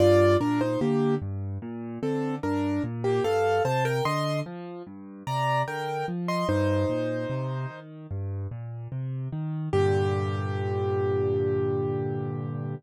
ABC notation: X:1
M:4/4
L:1/16
Q:1/4=74
K:Gm
V:1 name="Acoustic Grand Piano"
[Fd]2 [DB] [Ec] [B,G]2 z4 [CA]2 [DB]2 z [B,G] | [Af]2 [ca] [Bg] [ec']2 z4 [db]2 [Bg]2 z [ec'] | [Ec]8 z8 | G16 |]
V:2 name="Acoustic Grand Piano" clef=bass
G,,2 B,,2 D,2 G,,2 B,,2 D,2 G,,2 B,,2 | G,,2 C,2 D,2 F,2 G,,2 C,2 D,2 F,2 | G,,2 B,,2 C,2 E,2 G,,2 B,,2 C,2 E,2 | [G,,B,,D,]16 |]